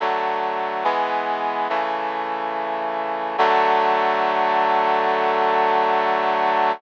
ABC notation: X:1
M:4/4
L:1/8
Q:1/4=71
K:D
V:1 name="Brass Section"
[D,F,A,]2 [E,^G,B,]2 [C,E,A,]4 | [D,F,A,]8 |]